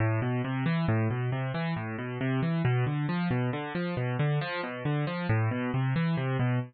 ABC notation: X:1
M:3/4
L:1/8
Q:1/4=136
K:Am
V:1 name="Acoustic Grand Piano" clef=bass
A,, B,, C, E, A,, B,, | C, E, A,, B,, C, E, | B,, D, F, B,, D, F, | B,, D, F, B,, D, F, |
A,, B,, C, E, C, B,, |]